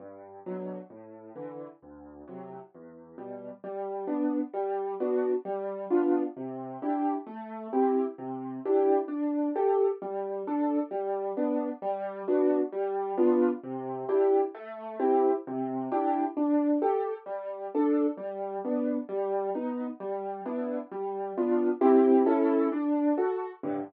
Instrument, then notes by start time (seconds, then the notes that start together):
acoustic grand piano
0.00 G2
0.46 B2 D3 F#3
0.90 A2
1.36 D3 E3
1.82 D2
2.28 A2 C3 F#3
2.75 E2
3.18 B2 G3
3.64 G3
4.07 B3 D4
4.54 G3
5.00 B3 D4 F#4
5.45 G3
5.90 B3 D4 F4
6.37 C3
6.82 D4 E4 G4
7.27 A3
7.73 C4 E4 G4
8.18 C3
8.65 D4 E4 G4
9.08 D4
9.56 G4 A4
10.02 G3
10.47 D4 A4
10.91 G3
11.37 B3 D4
11.82 G3
12.28 B3 D4 F#4
12.72 G3
13.18 B3 D4 F4
13.63 C3
14.09 D4 E4 G4
14.55 A3
15.00 C4 E4 G4
15.47 C3
15.92 D4 E4 G4
16.37 D4
16.82 G4 A4
17.26 G3
17.75 D4 A4
18.17 G3
18.65 B3 D4
19.09 G3
19.55 B3 D#4
20.00 G3
20.46 B3 D4 E4
20.91 G3
21.37 B3 D4 F4
21.81 C4 E4 G4
22.26 C#4 E4 A4
22.72 D4
23.18 F#4 A4
23.63 G2 A2 D3